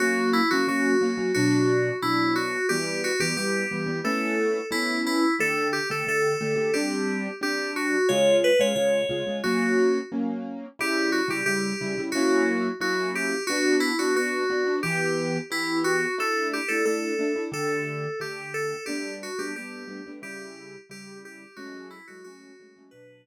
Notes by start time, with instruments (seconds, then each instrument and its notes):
0.00 acoustic grand piano F#3 A#3 C#4, electric piano 2 F#4
0.33 electric piano 2 E4
0.51 acoustic grand piano F#3 A#3 C#4, electric piano 2 F#4
0.68 acoustic grand piano F#3 A#3 C#4, electric piano 2 F#4
1.01 acoustic grand piano F#3 A#3 C#4
1.17 acoustic grand piano F#3 A#3 C#4
1.34 acoustic grand piano B2 F#3 D4, electric piano 2 F#4
2.02 acoustic grand piano B2 F#3 D4, electric piano 2 E4
2.36 electric piano 2 F#4
2.69 acoustic grand piano E3 G3 B3, electric piano 2 G4
3.04 electric piano 2 F#4
3.20 acoustic grand piano E3 G3 B3, electric piano 2 G4
3.37 acoustic grand piano E3 G3 B3, electric piano 2 G4
3.71 acoustic grand piano E3 G3 B3
3.86 acoustic grand piano E3 G3 B3
4.04 acoustic grand piano A3 B3 C#4 E4, electric piano 2 A4
4.71 acoustic grand piano A3 B3 C#4 E4, electric piano 2 E4
5.06 electric piano 2 E4
5.39 acoustic grand piano D3 A3 G4, electric piano 2 A4
5.73 electric piano 2 G4
5.90 acoustic grand piano D3 A3 G4, electric piano 2 A4
6.07 acoustic grand piano D3 A3 G4, electric piano 2 A4
6.41 acoustic grand piano D3 A3 G4
6.56 acoustic grand piano D3 A3 G4
6.74 acoustic grand piano G3 C4 D4, electric piano 2 G4
7.41 acoustic grand piano G3 C4 D4, electric piano 2 G4
7.76 electric piano 2 F#4
8.09 acoustic grand piano C#3 G#3 F4, electric piano 2 C#5
8.44 electric piano 2 B4
8.59 acoustic grand piano C#3 G#3 F4, electric piano 2 C#5
8.76 acoustic grand piano C#3 G#3 F4, electric piano 2 C#5
9.09 acoustic grand piano C#3 G#3 F4
9.27 acoustic grand piano C#3 G#3 F4
9.44 acoustic grand piano F#3 A#3 C#4, electric piano 2 F#4
10.12 acoustic grand piano F#3 A#3 C#4
10.79 acoustic grand piano C#3 G3 E4, electric piano 2 G4
11.12 electric piano 2 F#4
11.28 acoustic grand piano C#3 G3 E4, electric piano 2 G4
11.46 acoustic grand piano C#3 G3 E4, electric piano 2 G4
11.81 acoustic grand piano C#3 G3 E4
11.98 acoustic grand piano C#3 G3 E4
12.12 acoustic grand piano F#3 A#3 C#4 E4, electric piano 2 F#4
12.80 acoustic grand piano F#3 A#3 C#4 E4, electric piano 2 F#4
13.15 electric piano 2 G4
13.47 acoustic grand piano B3 D4 F#4, electric piano 2 F#4
13.80 electric piano 2 E4
13.99 acoustic grand piano B3 D4 F#4, electric piano 2 F#4
14.15 acoustic grand piano B3 D4 F#4, electric piano 2 F#4
14.50 acoustic grand piano B3 D4 F#4
14.66 acoustic grand piano B3 D4 F#4
14.83 acoustic grand piano E3 B3 G4, electric piano 2 G4
15.51 acoustic grand piano E3 B3 G4, electric piano 2 E4
15.84 electric piano 2 F#4
16.18 acoustic grand piano A3 D4 E4, electric piano 2 A4
16.53 electric piano 2 G4
16.68 acoustic grand piano A3 D4 E4, electric piano 2 A4
16.85 acoustic grand piano A3 D4 E4, electric piano 2 A4
17.19 acoustic grand piano A3 D4 E4
17.36 acoustic grand piano A3 D4 E4
17.52 acoustic grand piano D3 A3 G4, electric piano 2 A4
18.20 acoustic grand piano D3 A3 G4, electric piano 2 G4
18.54 electric piano 2 A4
18.86 acoustic grand piano G3 A3 B3 D4, electric piano 2 G4
19.23 electric piano 2 F#4
19.39 acoustic grand piano G3 A3 B3 D4, electric piano 2 G4
19.56 acoustic grand piano G3 A3 B3 D4, electric piano 2 G4
19.88 acoustic grand piano G3 A3 B3 D4
20.06 acoustic grand piano G3 A3 B3 D4
20.22 acoustic grand piano C#3 G3 E4, electric piano 2 G4
20.89 acoustic grand piano C#3 G3 E4, electric piano 2 G4
21.25 electric piano 2 G4
21.56 acoustic grand piano F#3 G#3 A3 C#4, electric piano 2 F#4
21.90 electric piano 2 E4
22.07 acoustic grand piano F#3 G#3 A3 C#4, electric piano 2 F#4
22.24 acoustic grand piano F#3 G#3 A3 C#4, electric piano 2 F#4
22.60 acoustic grand piano F#3 G#3 A3 C#4
22.76 acoustic grand piano F#3 G#3 A3 C#4
22.91 acoustic grand piano B2 F#3 D4, electric piano 2 B4